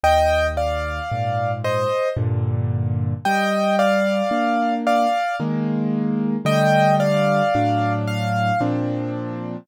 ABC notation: X:1
M:3/4
L:1/8
Q:1/4=56
K:Gm
V:1 name="Acoustic Grand Piano"
[eg] [df]2 [ce] z2 | [eg] [df]2 [df] z2 | [eg] [df]2 f z2 |]
V:2 name="Acoustic Grand Piano"
E,,2 [_A,,B,,]2 [G,,B,,D,]2 | G,2 [B,D]2 [E,_A,B,]2 | [D,G,A,]2 [A,,^F,D]2 [B,,=F,CD]2 |]